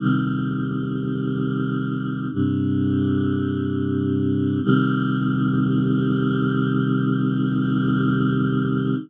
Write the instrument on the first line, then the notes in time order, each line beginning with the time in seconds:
choir aahs
0.00 C3 D#3 G3
2.31 G2 C3 G3
4.62 C3 D#3 G3